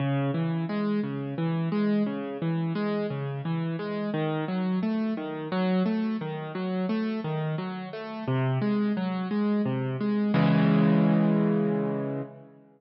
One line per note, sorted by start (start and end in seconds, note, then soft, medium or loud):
0.00 0.31 C#3 loud
0.34 0.65 E3 medium
0.69 1.00 G#3 medium
1.03 1.34 C#3 medium
1.38 1.69 E3 medium
1.72 2.03 G#3 medium
2.06 2.37 C#3 medium
2.42 2.73 E3 medium
2.75 3.06 G#3 medium
3.10 3.41 C#3 medium
3.45 3.76 E3 medium
3.79 4.10 G#3 medium
4.14 4.45 D#3 loud
4.48 4.79 F#3 medium
4.83 5.14 A3 medium
5.17 5.48 D#3 medium
5.52 5.83 F#3 loud
5.86 6.17 A3 medium
6.21 6.52 D#3 medium
6.55 6.86 F#3 medium
6.89 7.20 A3 medium
7.24 7.55 D#3 medium
7.58 7.89 F#3 medium
7.93 8.24 A3 medium
8.28 8.59 C3 loud
8.61 8.93 G#3 medium
8.97 9.28 F#3 medium
9.31 9.62 G#3 medium
9.66 9.97 C3 medium
10.01 10.32 G#3 medium
10.34 12.22 C#3 loud
10.34 12.22 E3 loud
10.34 12.22 G#3 medium